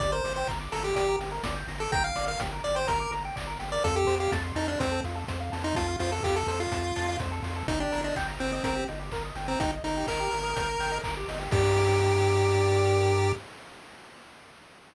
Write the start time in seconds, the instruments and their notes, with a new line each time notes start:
0.00 synth bass 1 G1, lead 1 (square) G4 D5, kick, closed hi-hat
0.12 lead 1 (square) A#4 C5
0.24 synth bass 1 G1, lead 1 (square) D5, open hi-hat
0.36 lead 1 (square) C5 G5
0.47 synth bass 1 G1, lead 1 (square) A#5, kick, clap
0.60 lead 1 (square) D6
0.72 synth bass 1 G1, lead 1 (square) A4 A#5, open hi-hat
0.84 lead 1 (square) G4 G5
0.96 synth bass 1 G1, lead 1 (square) G4 D5, kick, closed hi-hat
1.08 lead 1 (square) A#4
1.19 synth bass 1 G1, lead 1 (square) G4, open hi-hat
1.32 lead 1 (square) A#4
1.44 synth bass 1 G1, lead 1 (square) D5, kick, snare
1.56 lead 1 (square) G5
1.68 synth bass 1 G1, lead 1 (square) A#5, open hi-hat
1.80 lead 1 (square) A4 D6
1.92 synth bass 1 G1, lead 1 (square) G5 A#5, kick, closed hi-hat
2.03 lead 1 (square) F5 G5
2.16 synth bass 1 G1, lead 1 (square) D5, open hi-hat
2.27 lead 1 (square) A#4 F5
2.40 synth bass 1 G1, lead 1 (square) G4, kick, snare
2.52 lead 1 (square) A#4
2.64 synth bass 1 G1, lead 1 (square) D5, open hi-hat
2.75 lead 1 (square) C5 G5
2.87 synth bass 1 G1, lead 1 (square) A#4 A#5, kick, closed hi-hat
3.00 lead 1 (square) D6
3.11 synth bass 1 G1, lead 1 (square) A#5, open hi-hat
3.25 lead 1 (square) G5
3.36 synth bass 1 G1, lead 1 (square) D5, kick, clap
3.47 lead 1 (square) A#4
3.59 synth bass 1 G1, lead 1 (square) G4, open hi-hat
3.72 lead 1 (square) A#4 D5
3.84 synth bass 1 F2, lead 1 (square) F4 A4, kick, closed hi-hat
3.96 lead 1 (square) G4 A4
4.07 synth bass 1 F2, lead 1 (square) C5, open hi-hat
4.20 lead 1 (square) G4 F5
4.32 synth bass 1 F2, lead 1 (square) A5, kick, snare
4.44 lead 1 (square) C6
4.55 synth bass 1 F2, lead 1 (square) D#4 A5, open hi-hat
4.68 lead 1 (square) D4 F5
4.79 synth bass 1 F2, lead 1 (square) C4 C5, kick, closed hi-hat
4.92 lead 1 (square) A4
5.04 synth bass 1 F2, lead 1 (square) F4, open hi-hat
5.15 lead 1 (square) A4
5.27 synth bass 1 F2, lead 1 (square) C5, kick, snare
5.40 lead 1 (square) F5
5.52 synth bass 1 F2, lead 1 (square) A5, open hi-hat
5.64 lead 1 (square) D#4 C6
5.75 synth bass 1 F2, lead 1 (square) F4 A5, kick, closed hi-hat
5.88 lead 1 (square) F5
5.99 synth bass 1 F2, lead 1 (square) F4 C5, open hi-hat
6.12 lead 1 (square) A4
6.23 synth bass 1 F2, lead 1 (square) F4 G4, kick, clap
6.36 lead 1 (square) A4
6.47 synth bass 1 F2, lead 1 (square) A4 C5, open hi-hat
6.60 lead 1 (square) F4 F5
6.72 synth bass 1 F2, lead 1 (square) A5, kick, closed hi-hat
6.85 lead 1 (square) C6
6.96 synth bass 1 F2, lead 1 (square) A5, open hi-hat
7.09 lead 1 (square) F5
7.20 synth bass 1 F2, lead 1 (square) C5, kick, snare
7.32 lead 1 (square) A4
7.43 synth bass 1 F2, lead 1 (square) F4, open hi-hat
7.56 lead 1 (square) A4
7.68 synth bass 1 G1, lead 1 (square) D#4, kick, closed hi-hat
7.80 lead 1 (square) D4 G4
7.92 synth bass 1 G1, lead 1 (square) A#4, open hi-hat
8.04 lead 1 (square) D4 D#5
8.16 synth bass 1 G1, lead 1 (square) G5, kick, clap
8.28 lead 1 (square) A#5
8.39 synth bass 1 G1, lead 1 (square) C4 G5, open hi-hat
8.52 lead 1 (square) C4 D#5
8.63 synth bass 1 G1, lead 1 (square) C4 A#4, kick, closed hi-hat
8.76 lead 1 (square) G4
8.88 synth bass 1 G1, lead 1 (square) D#4, open hi-hat
8.99 lead 1 (square) G4
9.12 synth bass 1 G1, lead 1 (square) A#4, kick, clap
9.24 lead 1 (square) D#5
9.35 synth bass 1 G1, lead 1 (square) G5, open hi-hat
9.48 lead 1 (square) C4 A#5
9.60 synth bass 1 G1, lead 1 (square) D#4 G5, kick, closed hi-hat
9.72 lead 1 (square) D#5
9.84 synth bass 1 G1, lead 1 (square) D#4 A#4, open hi-hat
9.97 lead 1 (square) G4
10.07 synth bass 1 G1, lead 1 (square) D#4 A#4, kick, clap
10.20 lead 1 (square) G4
10.31 synth bass 1 G1, lead 1 (square) A#4, open hi-hat
10.44 lead 1 (square) D#5
10.56 synth bass 1 G1, lead 1 (square) G5, kick, closed hi-hat
10.69 lead 1 (square) A#5
10.79 synth bass 1 G1, lead 1 (square) G5, open hi-hat
10.92 lead 1 (square) D#5
11.04 synth bass 1 G1, lead 1 (square) A#4, kick, clap
11.17 lead 1 (square) G4
11.28 synth bass 1 G1, lead 1 (square) D#4, open hi-hat
11.39 lead 1 (square) G4
11.51 synth bass 1 G2, lead 1 (square) G4 A#4 D5, kick, crash